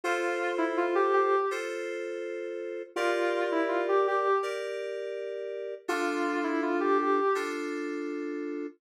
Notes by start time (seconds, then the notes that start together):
0.04 F4 A4 C5
0.58 E4
0.77 F4
0.95 G4
1.13 G4
1.51 F4 A4 C5
2.96 F4 G4 A#4 D5
3.52 E4
3.68 F4
3.88 G4
4.07 G4
4.43 G4 A#4 D5
5.88 D4 F4 A4
6.44 E4
6.62 F4
6.80 G4
6.98 G4
7.35 D4 F4 A4